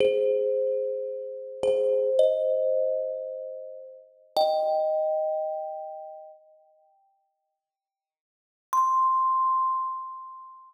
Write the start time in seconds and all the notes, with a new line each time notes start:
0.00 G#4 C5
1.63 G#4 C5
2.19 C5 D#5
4.37 D#5 G5
8.73 C6